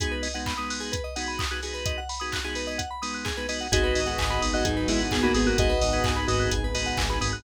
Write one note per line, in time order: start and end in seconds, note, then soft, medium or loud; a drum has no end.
0.00 0.28 G#3 medium
0.00 0.28 B3 medium
0.00 0.28 D#4 medium
0.00 0.28 F#4 medium
0.00 0.11 G#4 medium
0.00 kick loud
0.00 closed hi-hat loud
0.11 0.22 B4 medium
0.23 0.33 D#5 medium
0.23 open hi-hat medium
0.34 0.53 G#3 medium
0.34 0.53 B3 medium
0.34 0.53 D#4 medium
0.34 0.53 F#4 medium
0.34 0.45 F#5 medium
0.46 0.57 B5 medium
0.46 kick medium
0.46 clap medium
0.57 0.95 G#3 medium
0.57 0.95 B3 medium
0.57 0.95 D#4 medium
0.57 0.95 F#4 medium
0.57 0.68 D#6 medium
0.70 0.81 F#6 medium
0.70 open hi-hat medium
0.80 0.91 G#4 medium
0.92 1.02 B4 medium
0.92 kick medium
0.92 closed hi-hat medium
1.04 1.14 D#5 medium
1.16 1.44 G#3 medium
1.16 1.44 B3 medium
1.16 1.44 D#4 medium
1.16 1.44 F#4 medium
1.16 1.26 F#5 medium
1.16 open hi-hat medium
1.28 1.38 B5 medium
1.39 1.49 D#6 medium
1.39 kick medium
1.39 clap loud
1.51 1.60 G#3 medium
1.51 1.60 B3 medium
1.51 1.60 D#4 medium
1.51 1.60 F#4 medium
1.51 1.61 F#6 medium
1.63 2.00 G#3 medium
1.63 2.00 B3 medium
1.63 2.00 D#4 medium
1.63 2.00 F#4 medium
1.63 1.73 G#4 medium
1.63 open hi-hat medium
1.74 1.84 B4 medium
1.86 1.96 D#5 medium
1.86 kick medium
1.86 closed hi-hat medium
1.98 2.08 F#5 medium
2.09 2.20 B5 medium
2.09 open hi-hat medium
2.20 2.40 G#3 medium
2.20 2.40 B3 medium
2.20 2.40 D#4 medium
2.20 2.40 F#4 medium
2.20 2.30 D#6 medium
2.32 2.44 F#6 medium
2.32 kick medium
2.32 clap loud
2.44 2.81 G#3 medium
2.44 2.81 B3 medium
2.44 2.81 D#4 medium
2.44 2.81 F#4 medium
2.44 2.55 G#4 medium
2.55 2.66 B4 medium
2.55 open hi-hat medium
2.67 2.78 D#5 medium
2.78 2.89 F#5 medium
2.78 kick medium
2.78 closed hi-hat medium
2.91 3.01 B5 medium
3.02 3.30 G#3 medium
3.02 3.30 B3 medium
3.02 3.30 D#4 medium
3.02 3.30 F#4 medium
3.02 3.12 D#6 medium
3.02 open hi-hat medium
3.14 3.25 F#6 medium
3.25 3.35 G#4 medium
3.25 kick medium
3.25 clap medium
3.37 3.47 G#3 medium
3.37 3.47 B3 medium
3.37 3.47 D#4 medium
3.37 3.47 F#4 medium
3.37 3.48 B4 medium
3.49 3.67 G#3 medium
3.49 3.67 B3 medium
3.49 3.67 D#4 medium
3.49 3.67 F#4 medium
3.49 3.59 D#5 medium
3.49 open hi-hat medium
3.61 3.71 F#5 medium
3.71 3.92 G#1 loud
3.71 4.00 G#3 medium
3.71 5.55 B3 medium
3.71 4.00 B3 medium
3.71 5.55 D#4 medium
3.71 4.00 D#4 medium
3.71 5.55 F#4 medium
3.71 4.00 F#4 medium
3.71 4.41 F#4 medium
3.71 5.55 G#4 medium
3.71 3.82 G#4 loud
3.71 4.41 D#5 medium
3.71 kick loud
3.71 closed hi-hat loud
3.84 3.94 B4 medium
3.95 4.15 G#1 loud
3.95 4.06 D#5 medium
3.95 open hi-hat medium
4.06 4.26 G#3 medium
4.06 4.26 B3 medium
4.06 4.26 D#4 medium
4.06 4.26 F#4 medium
4.06 4.17 F#5 medium
4.18 4.38 G#1 medium
4.18 4.29 G#5 medium
4.18 kick medium
4.18 clap loud
4.30 4.67 G#3 medium
4.30 4.67 B3 medium
4.30 4.67 D#4 medium
4.30 4.67 F#4 medium
4.30 4.41 B5 medium
4.42 4.62 G#1 loud
4.42 4.52 D#6 medium
4.42 open hi-hat medium
4.53 4.65 F#4 medium
4.53 4.65 D#5 medium
4.53 4.64 F#6 medium
4.64 4.85 G#1 medium
4.64 4.88 F#3 medium
4.64 4.88 D#4 medium
4.64 4.75 G#4 medium
4.64 kick medium
4.64 closed hi-hat medium
4.77 4.87 B4 medium
4.88 5.08 G#1 medium
4.88 4.99 G#3 medium
4.88 5.16 G#3 medium
4.88 5.16 B3 medium
4.88 5.16 D#4 medium
4.88 4.99 E4 medium
4.88 5.16 F#4 medium
4.88 4.98 D#5 medium
4.88 open hi-hat medium
5.00 5.11 F#5 medium
5.11 5.32 G#1 loud
5.11 5.23 B3 medium
5.11 5.23 G#4 medium
5.11 5.22 G#5 medium
5.11 kick medium
5.11 clap loud
5.23 5.33 G#3 medium
5.23 5.34 A#3 medium
5.23 5.33 B3 medium
5.23 5.33 D#4 medium
5.23 5.34 F#4 medium
5.23 5.33 F#4 medium
5.23 5.33 B5 medium
5.34 5.55 G#1 medium
5.34 5.72 G#3 medium
5.34 5.72 B3 medium
5.34 5.46 B3 medium
5.34 5.72 D#4 medium
5.34 5.72 F#4 medium
5.34 5.46 G#4 medium
5.34 5.45 D#6 medium
5.34 open hi-hat medium
5.46 5.57 A#3 medium
5.46 5.57 F#4 medium
5.46 5.57 F#6 medium
5.57 5.78 G#1 loud
5.57 7.42 B3 medium
5.57 7.42 D#4 medium
5.57 6.17 F#4 medium
5.57 7.42 G#4 medium
5.57 5.69 G#4 medium
5.57 7.42 B4 medium
5.57 6.17 D#5 medium
5.57 kick loud
5.57 closed hi-hat loud
5.69 5.80 B4 loud
5.81 6.01 G#1 loud
5.81 5.92 D#5 medium
5.81 open hi-hat medium
5.93 6.12 G#3 medium
5.93 6.12 B3 medium
5.93 6.12 D#4 medium
5.93 6.12 F#4 medium
5.93 6.03 F#5 medium
6.04 6.25 G#1 medium
6.04 6.16 G#5 medium
6.04 kick loud
6.04 clap loud
6.16 6.53 G#3 medium
6.16 6.53 B3 medium
6.16 6.53 D#4 medium
6.16 6.53 F#4 medium
6.16 6.27 B5 medium
6.27 6.47 G#1 loud
6.27 6.49 F#4 medium
6.27 6.49 D#5 medium
6.27 6.39 D#6 medium
6.27 open hi-hat medium
6.40 6.50 F#6 medium
6.51 6.71 G#1 loud
6.51 6.63 G#4 medium
6.51 kick medium
6.51 closed hi-hat medium
6.64 6.74 B4 medium
6.74 6.94 G#1 loud
6.74 7.02 G#3 medium
6.74 7.02 B3 medium
6.74 7.02 D#4 medium
6.74 7.02 F#4 medium
6.74 6.85 D#5 medium
6.74 open hi-hat medium
6.86 6.97 F#5 medium
6.97 7.17 G#1 loud
6.97 7.08 G#5 medium
6.97 kick medium
6.97 clap loud
7.09 7.19 G#3 medium
7.09 7.19 B3 medium
7.09 7.19 D#4 medium
7.09 7.19 F#4 medium
7.09 7.20 B5 medium
7.21 7.41 G#1 loud
7.21 7.40 G#3 medium
7.21 7.40 B3 medium
7.21 7.40 D#4 medium
7.21 7.40 F#4 medium
7.21 7.32 D#6 medium
7.21 open hi-hat medium
7.33 7.43 F#6 medium